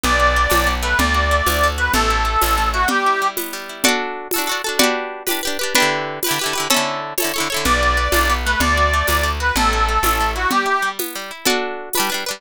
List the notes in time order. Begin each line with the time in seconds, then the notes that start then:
0.04 B1 B3 D5, low conga
0.20 F#4
0.36 B3
0.50 B1 D4, tambourine, high conga
0.67 B3
0.83 A3 B4
0.99 D2 D5, low conga
1.14 F#4
1.31 A3
1.46 D2 D4, tambourine, high conga
1.63 A3
1.78 F#4 B4
1.94 A1 A3 A4, low conga
2.10 E4
2.25 A3
2.41 A1 C#4, tambourine, high conga
2.58 A3
2.73 E4 F#4
2.88 G3 G4, low conga
3.06 E4
3.22 G3
3.37 B3, tambourine, high conga
3.53 G3
3.69 E4
3.84 F#4 A4 D5, low conga
3.88 D4
4.31 A4, tambourine, high conga
4.36 D4 F#4
4.47 F#4 A4
4.52 D4
4.64 F#4 A4
4.69 D4
4.79 F#4 G4 B4 D5, low conga
4.83 D4
5.27 G4 B4, tambourine, high conga
5.31 D4
5.43 G4 B4
5.47 D4
5.59 G4 B4
5.63 D4
5.75 D4 G4 B4, low conga
5.80 D3 E4
6.23 G4 B4, tambourine, high conga
6.29 D3 E4
6.39 G4 B4
6.44 D3 E4
6.53 G4 B4
6.58 D3 E4
6.70 C#4 A4 C#5, low conga
6.74 D3 E4
7.18 A4 C#5, tambourine, high conga
7.22 D3 E4
7.34 A4 C#5
7.38 D3 E4
7.50 A4 C#5
7.54 D3 E4
7.65 B1 B3 D5, low conga
7.83 F#4
7.97 B3
8.12 B1 D4, tambourine, high conga
8.29 B3
8.45 A3 B4
8.60 D2 D5, low conga
8.77 F#4
8.93 A3
9.07 D2 D4, tambourine, high conga
9.23 A3
9.40 F#4 B4
9.56 A1 A3 A4, low conga
9.73 E4
9.89 A3
10.03 A1 C#4, tambourine, high conga
10.20 A3
10.35 E4 F#4
10.51 G3 G4, low conga
10.66 E4
10.82 G3
10.99 B3, tambourine, high conga
11.15 G3
11.31 E4
11.45 F#4 A4 D5, low conga
11.50 D4
11.93 B4, tambourine, high conga
11.97 G3 D4
12.10 D4 B4
12.14 G3
12.26 D4 B4
12.31 G3